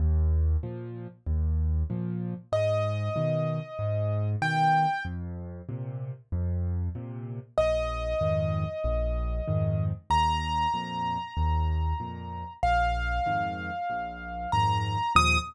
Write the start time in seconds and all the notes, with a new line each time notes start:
0.00 D#2
0.63 A#2 F3
1.27 D#2
1.90 A#2 F3
2.52 G#2 D#5
3.16 B2 D#3
3.79 G#2
4.42 B2 D#3 G5
5.05 F2
5.69 A#2 C3
6.32 F2
6.95 A#2 C3
7.58 A#1 D#5
8.21 F2 G#2 D#3
8.84 A#1
9.48 F2 G#2 D#3
10.10 D#2 A#5
10.74 F2 A#2
11.37 D#2
12.00 F2 A#2
12.63 A#1 F5
13.26 F2 G#2 D#3
13.90 A#1
14.52 F2 G#2 D#3 A#5
15.15 D#2 A#2 F3 D#6